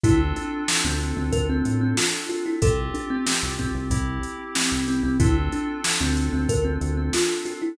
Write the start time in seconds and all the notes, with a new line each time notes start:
0.03 D2 C4 D4 E4 F4 A4, kick, closed hi-hat
0.36 D4, closed hi-hat
0.68 snare
0.85 D2 C4
1.00 closed hi-hat
1.17 D2 C4
1.32 D2 A#4, kick, closed hi-hat
1.49 C4
1.65 A2, closed hi-hat
1.81 C4
1.97 F4, snare
2.29 F4, closed hi-hat
2.46 E4
2.62 C2 C4 F4 G4 A4, kick, closed hi-hat
2.94 D4, closed hi-hat
3.10 C4
3.26 C4, snare
3.43 C2
3.59 C4, kick, closed hi-hat
3.75 C2
3.90 C2 C4 E4 G4, kick, closed hi-hat
4.23 closed hi-hat
4.55 C4, snare
4.72 C2
4.88 C4, closed hi-hat
5.03 C2 C4
5.20 D2 C4 D4 E4 F4 A4, kick, closed hi-hat
5.52 D4, closed hi-hat
5.84 snare
6.00 D2 C4
6.17 closed hi-hat
6.33 D2 C4
6.49 D2 A#4, kick, closed hi-hat
6.65 C4
6.81 D2, closed hi-hat
6.97 C4
7.13 F4, snare
7.45 F4, closed hi-hat
7.62 E4